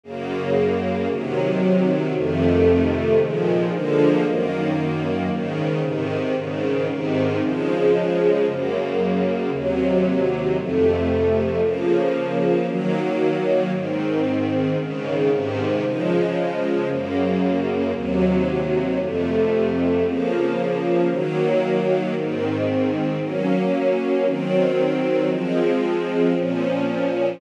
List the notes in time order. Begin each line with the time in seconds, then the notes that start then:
0.04 F#2 C#3 A#3
1.10 C3 D#3 F#3
2.14 F2 C3 D#3 A3
3.19 A#2 D#3 F3 G#3
3.72 D3 F3 G#3 A#3
4.25 F#2 D#3 A#3
5.30 G#2 C#3 D#3
5.82 G#2 C3 D#3
6.35 G#2 C#3 D#3
6.88 G#2 C3 D#3
7.41 C#3 F3 G#3
8.46 F#2 C#3 A#3
9.52 D#2 C3 F#3
10.56 F2 C3 A3
11.61 C#3 F3 A#3
12.67 D#3 F#3 A#3
13.72 G#2 D#3 C4
14.78 G#2 C#3 D#3
15.30 G#2 C3 D#3
15.83 C#3 F3 G#3
16.88 F#2 C#3 A#3
17.93 D#2 C3 F#3
18.99 F2 C3 A3
20.04 C#3 F3 A#3
21.09 D#3 F#3 A#3
22.14 G#2 D#3 C4
23.20 F#3 A#3 C#4
24.26 D#3 F#3 C4
25.29 F3 G#3 C4
26.36 A#2 F3 C#4